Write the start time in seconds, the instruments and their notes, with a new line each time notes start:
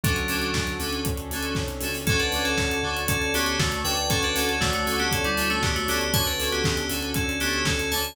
0.03 synth bass 2 D2, electric piano 2 F#3 C#4 D4 F#4 A4, pad 5 (bowed) C#4 D4 F#4 A4, kick, closed hi-hat
0.16 closed hi-hat
0.28 synth bass 2 D2, electric piano 2 C#4 D4 F#4 A4, open hi-hat
0.42 closed hi-hat
0.54 synth bass 2 D2, kick, snare
0.67 closed hi-hat
0.79 synth bass 2 D2, electric piano 2 C#4 D4 F#4 A4, open hi-hat
0.92 closed hi-hat
1.05 synth bass 2 D2, pad 5 (bowed) C#4 D4 A4 C#5, kick, closed hi-hat
1.17 closed hi-hat
1.31 synth bass 2 D2, electric piano 2 C#4 D4 F#4 A4, open hi-hat
1.43 closed hi-hat
1.55 synth bass 2 C2, kick, snare
1.68 closed hi-hat
1.81 synth bass 2 C#2, electric piano 2 C#4 D4 F#4 A4, open hi-hat
1.94 open hi-hat
2.07 synth bass 2 D2, electric piano 2 C#4 D4 F#4 A4, pad 5 (bowed) C#5 D5 F#5 A5, kick, closed hi-hat
2.19 electric piano 2 D4 B4, closed hi-hat
2.32 synth bass 2 D2, electric piano 2 C#4 D4 F#4 A4, open hi-hat
2.45 electric piano 2 C#4 A4, closed hi-hat
2.58 synth bass 2 D2, kick, snare
2.71 closed hi-hat
2.83 synth bass 2 D2, electric piano 2 C#4 D4 F#4 A4
2.97 closed hi-hat
3.08 synth bass 2 D2, electric piano 2 C#4 A4, pad 5 (bowed) C#5 D5 A5 C#6, kick, closed hi-hat
3.22 closed hi-hat
3.34 synth bass 2 D2, electric piano 2 B3 C#4 D4 F#4 G4 A4, open hi-hat
3.46 closed hi-hat
3.59 synth bass 2 D2, electric piano 2 A3 F#4, kick, snare
3.72 closed hi-hat
3.84 synth bass 2 D2, electric piano 2 C#4 D4 F#4 A4 B4 G5, open hi-hat
3.97 closed hi-hat
4.09 electric piano 2 C#4 D4 F#4 A4, pad 5 (bowed) C#5 D5 F#5 A5, kick, closed hi-hat
4.23 electric piano 2 D4 B4, closed hi-hat
4.34 synth bass 2 D2, electric piano 2 C#4 D4 F#4 A4, open hi-hat
4.49 electric piano 2 C#4 A4, closed hi-hat
4.61 synth bass 2 D2, electric piano 2 A3 F#4, kick, snare
4.73 electric piano 2 A3 F#4, closed hi-hat
4.86 synth bass 2 D2, electric piano 2 C#4 D4 F#4 A4, open hi-hat
4.99 electric piano 2 B3 G4, closed hi-hat
5.11 synth bass 2 D2, electric piano 2 C#4 A4, pad 5 (bowed) C#5 D5 A5 C#6, kick, closed hi-hat
5.24 electric piano 2 G3 E4, closed hi-hat
5.37 synth bass 2 D2, electric piano 2 C#4 D4 F#4 A4, open hi-hat
5.50 electric piano 2 A3 F#4, closed hi-hat
5.62 synth bass 2 D2, electric piano 2 B3 G4, kick, snare
5.76 electric piano 2 A3 F#4, closed hi-hat
5.88 synth bass 2 D2, electric piano 2 B3 C#4 D4 F#4 G4 A4, open hi-hat
6.01 closed hi-hat
6.13 synth bass 2 D2, electric piano 2 C#4 D4 F#4 A4 C#5 A5, pad 5 (bowed) C#4 D4 F#4 A4, kick, closed hi-hat
6.26 electric piano 2 D4 B4, closed hi-hat
6.39 synth bass 2 D2, electric piano 2 C#4 D4 F#4 A4, open hi-hat
6.52 electric piano 2 B3 G4, closed hi-hat
6.64 synth bass 2 D2, kick, snare
6.77 closed hi-hat
6.90 synth bass 2 D2, electric piano 2 C#4 D4 F#4 A4, open hi-hat
7.02 closed hi-hat
7.14 synth bass 2 D2, electric piano 2 C#4 A4, pad 5 (bowed) C#4 D4 A4 C#5, kick, closed hi-hat
7.29 closed hi-hat
7.40 synth bass 2 D2, electric piano 2 B3 C#4 D4 F#4 G4 A4, open hi-hat
7.53 closed hi-hat
7.65 synth bass 2 D2, electric piano 2 C#4 A4, kick, snare
7.79 closed hi-hat
7.91 synth bass 2 D2, electric piano 2 C#4 D4 F#4 A4 C#5 A5, open hi-hat
8.04 closed hi-hat